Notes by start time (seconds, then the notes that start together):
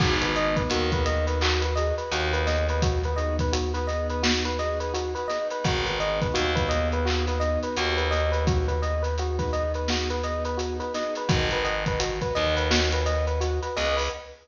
0.00 G#1 B3 D#4 F#4 G#4, kick, crash
0.22 B4, closed hi-hat
0.35 B3 D#4 F#4 G#4 D#5, closed hi-hat
0.56 B4, kick, closed hi-hat
0.70 D#2 F#4, closed hi-hat
0.92 B3 D#4 F#4 G#4 B4, kick, closed hi-hat
1.06 B3 D#4 F#4 G#4 D#5, closed hi-hat
1.27 B4, closed hi-hat
1.41 F#4, clap
1.61 B4, closed hi-hat
1.75 B3 D#4 F#4 G#4 D#5, closed hi-hat
1.98 B4, closed hi-hat
2.11 D#2 F#4, closed hi-hat
2.33 B4, closed hi-hat
2.46 B3 D#4 F#4 G#4 D#5, snare, closed hi-hat
2.69 B4, closed hi-hat
2.82 F#4, kick, closed hi-hat
3.04 B4, closed hi-hat
3.16 B3 D#4 F#4 G#4 D#5, closed hi-hat
3.39 B4, kick, closed hi-hat
3.53 F#4, closed hi-hat
3.74 B3 D#4 F#4 G#4 B4, closed hi-hat
3.87 B3 D#4 F#4 G#4 D#5, snare, closed hi-hat
4.09 B4, closed hi-hat
4.23 F#4, snare
4.45 B4, closed hi-hat
4.58 B3 D#4 F#4 G#4 D#5, closed hi-hat
4.80 B4, closed hi-hat
4.94 F#4, closed hi-hat
5.15 B4, closed hi-hat
5.28 B3 D#4 F#4 G#4 D#5, snare, closed hi-hat
5.50 B4, closed hi-hat
5.64 G#1 F#4, kick, closed hi-hat
5.85 B4, snare, closed hi-hat
5.99 B3 D#4 F#4 G#4 D#5, closed hi-hat
6.21 B4, kick, closed hi-hat
6.34 D#2 F#4, closed hi-hat
6.55 B3 D#4 F#4 G#4 B4, kick, closed hi-hat
6.69 B3 D#4 F#4 G#4 D#5, closed hi-hat
6.92 B4, closed hi-hat
7.05 F#4, clap
7.27 B4, snare, closed hi-hat
7.40 B3 D#4 F#4 G#4 D#5, closed hi-hat
7.63 B4, closed hi-hat
7.76 D#2 F#4, closed hi-hat
7.97 B4, closed hi-hat
8.11 B3 D#4 F#4 G#4 D#5, snare, closed hi-hat
8.32 B4, closed hi-hat
8.47 F#4, kick, closed hi-hat
8.68 B4, closed hi-hat
8.82 B3 D#4 F#4 G#4 D#5, closed hi-hat
9.02 B4, closed hi-hat
9.18 F#4, closed hi-hat
9.39 B3 D#4 F#4 G#4 B4, kick, closed hi-hat
9.53 B3 D#4 F#4 G#4 D#5, closed hi-hat
9.74 B4, closed hi-hat
9.88 F#4, snare
10.10 B4, closed hi-hat
10.23 B3 D#4 F#4 G#4 D#5, closed hi-hat
10.45 B4, closed hi-hat
10.57 F#4, closed hi-hat
10.80 B4, closed hi-hat
10.94 B3 D#4 F#4 G#4 D#5, snare, closed hi-hat
11.15 B4, closed hi-hat
11.29 G#1 F#4 B4 D#5 F#5 G#5, kick, closed hi-hat
11.51 B4, closed hi-hat
11.64 B4 D#5 F#5 G#5, closed hi-hat
11.86 B4, kick, closed hi-hat
12.00 F#4, closed hi-hat
12.21 B4 D#5 F#5 G#5, kick, closed hi-hat
12.35 D#2 B4 D#5 F#5 G#5, closed hi-hat
12.57 B4, closed hi-hat
12.71 F#4, snare
12.92 B4, closed hi-hat
13.06 B4 D#5 F#5 G#5, closed hi-hat
13.27 B4, closed hi-hat
13.41 F#4, closed hi-hat
13.62 B4, closed hi-hat
13.76 C#2 B4 D#5 F#5 G#5, snare, closed hi-hat
13.97 B4, open hi-hat